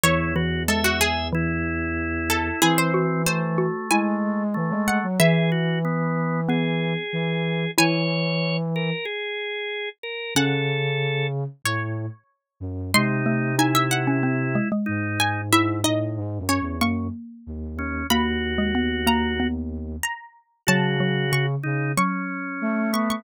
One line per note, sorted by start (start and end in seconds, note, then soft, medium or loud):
0.03 2.49 E2 medium
0.03 0.32 E3 medium
0.03 0.34 E4 loud
0.03 0.61 C#5 loud
0.36 0.65 E3 medium
0.36 0.63 F#4 medium
0.68 1.24 G#3 medium
0.68 0.84 A4 medium
0.68 1.28 E5 medium
0.84 1.00 F#4 medium
1.01 1.29 G#4 loud
1.33 2.56 E3 medium
1.33 2.60 E4 loud
2.30 2.60 A4 medium
2.62 3.66 E3 medium
2.62 3.22 C4 loud
2.62 2.92 E4 medium
2.62 2.77 G#4 loud
2.78 3.04 C5 loud
2.94 3.57 F#4 medium
3.26 4.43 A3 medium
3.26 3.87 C5 medium
3.58 3.88 F#4 medium
3.91 4.54 G#3 medium
3.91 5.01 E4 medium
3.91 4.81 G#5 loud
4.54 4.71 E3 medium
4.54 5.06 A3 medium
4.70 4.99 G#3 medium
4.88 5.16 F#5 medium
5.03 5.19 F#3 medium
5.20 6.24 E3 medium
5.20 6.94 E3 medium
5.20 5.50 G#4 loud
5.20 7.37 E5 loud
5.52 5.79 F#4 medium
5.85 6.41 B3 loud
6.49 7.04 B3 medium
6.49 7.71 G#4 medium
7.13 7.65 E3 medium
7.78 8.90 E3 medium
7.78 10.03 E4 medium
7.78 8.57 C#5 loud
7.78 9.93 G#5 loud
8.76 9.05 A#4 medium
9.05 9.89 G#4 loud
10.03 10.34 A#4 medium
10.35 11.44 C#3 medium
10.35 11.55 C#4 medium
10.35 11.27 A4 loud
10.35 11.48 F#5 loud
11.65 12.06 A2 medium
11.65 12.60 C#5 medium
12.60 12.91 F#2 medium
12.94 14.57 C3 medium
12.94 13.23 G#3 medium
12.94 13.56 D#4 loud
12.94 13.49 C6 loud
13.26 13.53 A3 medium
13.59 14.04 D#4 medium
13.59 14.69 E4 medium
13.59 13.74 G#5 medium
13.75 13.90 E5 loud
13.91 14.19 F#5 medium
14.07 14.23 C#4 medium
14.23 14.53 C4 medium
14.55 14.71 G#3 medium
14.72 15.46 G#3 medium
14.86 15.51 G#2 medium
14.86 15.41 D#4 loud
15.20 15.48 G#5 loud
15.51 15.81 G#2 loud
15.51 15.79 E4 medium
15.51 15.82 E5 loud
15.84 16.18 A2 medium
15.84 16.39 D#4 medium
15.84 16.46 D#5 medium
16.17 16.38 G#2 medium
16.38 16.59 F#2 medium
16.49 16.76 C#4 medium
16.49 16.79 C#5 medium
16.61 16.81 E2 medium
16.81 17.08 F#2 medium
16.81 18.03 A#3 medium
16.81 17.08 C#6 medium
17.47 17.75 D#2 medium
17.76 18.03 D#2 medium
17.76 18.07 C#4 loud
18.10 19.96 D#2 medium
18.10 18.53 A#3 medium
18.10 19.47 F#4 loud
18.10 19.01 B5 loud
18.58 18.74 G#3 medium
18.75 19.02 B3 medium
19.07 19.34 A#3 medium
19.07 19.97 A#5 medium
19.40 20.00 B3 medium
20.03 20.61 A#5 medium
20.67 21.55 C#3 medium
20.67 20.97 F#3 medium
20.67 21.46 F#4 loud
20.67 21.23 A5 loud
21.00 21.26 F#3 medium
21.32 21.90 C#3 medium
21.32 21.87 C#6 loud
21.63 21.92 C#3 medium
21.63 21.92 D#4 medium
21.97 23.24 F#3 medium
21.97 22.91 C#4 medium
21.97 22.49 C#6 medium
22.62 23.22 A3 medium
22.93 23.22 B3 loud
22.93 23.09 C#6 medium
23.10 23.24 C#6 medium